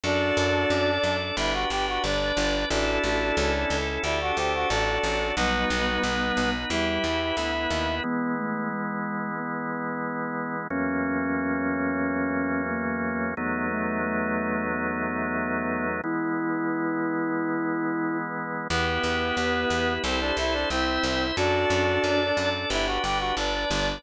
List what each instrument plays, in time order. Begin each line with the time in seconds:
0.03 electric bass (finger) F#2, ocarina D4 F#4, drawbar organ D4 F#4 A4, clarinet D4 D5
0.37 electric bass (finger) F#2
0.70 electric bass (finger) F#2, drawbar organ D4 A4 D5
1.03 electric bass (finger) F#2
1.37 electric bass (finger) G1, drawbar organ D4 G4 B4, clarinet E4 E5
1.53 clarinet F#4 F#5
1.70 electric bass (finger) G1, clarinet G4 G5
1.88 clarinet F#4 F#5
2.03 electric bass (finger) G1, drawbar organ D4 B4 D5, clarinet D4 D5
2.37 electric bass (finger) G1
2.70 electric bass (finger) A1, clarinet D4 D5, drawbar organ D4 E4 A4, ocarina F#4 A4
3.04 electric bass (finger) A1
3.37 electric bass (finger) C#2, drawbar organ C#4 E4 A4
3.70 electric bass (finger) C#2, ocarina A4
4.03 electric bass (finger) D2, drawbar organ D4 G4 A4, clarinet E4 E5, ocarina D5
4.21 clarinet F#4 F#5
4.37 electric bass (finger) D2, clarinet G4 G5, ocarina C5
4.55 clarinet F#4 F#5
4.69 electric bass (finger) A1, clarinet D4 D5, drawbar organ D4 F#4 A4, ocarina A4
5.03 electric bass (finger) A1
5.36 electric bass (finger) B1, ocarina G3 B3, clarinet B3 B4, drawbar organ D#4 F#4 B4
5.70 electric bass (finger) B1
6.03 electric bass (finger) B1, drawbar organ B3 D#4 B4
6.37 electric bass (finger) B1
6.70 electric bass (finger) E2, ocarina G3, drawbar organ E4 G4 B4, clarinet E4 E5
7.04 electric bass (finger) E2
7.37 electric bass (finger) D2, drawbar organ B3 E4 B4
7.70 electric bass (finger) D#2
8.03 drawbar organ E3 G#3 B3, ocarina B3
8.37 ocarina A3
8.70 ocarina G#3
9.37 ocarina B3
10.70 drawbar organ E2 F#3 A#3 C#4, ocarina C#4
12.70 ocarina A#3
13.37 drawbar organ E2 F#3 A3 B3 D#4, ocarina B3
13.70 ocarina A3
14.03 ocarina A3
14.70 ocarina B3
16.04 drawbar organ E3 G#3 B3, ocarina E4
18.69 electric bass (finger) E2, clarinet B3 B4, drawbar organ E4 G4 B4
19.03 electric bass (finger) E2
19.37 electric bass (finger) E2, drawbar organ B3 E4 B4, ocarina G4
19.70 electric bass (finger) E2
20.04 electric bass (finger) C2, clarinet C4 C5, drawbar organ E4 A4 C5
20.20 clarinet D4 D5
20.37 electric bass (finger) C2, clarinet E4 E5
20.53 clarinet D4 D5
20.70 electric bass (finger) C2, clarinet C4 C5, ocarina E4, drawbar organ E4 C5 E5
21.03 electric bass (finger) C2
21.37 electric bass (finger) F#2, clarinet D4 D5, ocarina D4 F#4, drawbar organ D4 F#4 A4
21.70 electric bass (finger) F#2
22.04 electric bass (finger) F#2, drawbar organ D4 A4 D5
22.37 electric bass (finger) F#2
22.70 electric bass (finger) G1, drawbar organ D4 G4 B4, clarinet E4 E5
22.86 clarinet F#4 F#5
23.02 electric bass (finger) G1, clarinet G4 G5
23.19 clarinet F#4 F#5
23.37 electric bass (finger) G1, clarinet D4 D5, drawbar organ D4 B4 D5
23.71 electric bass (finger) G1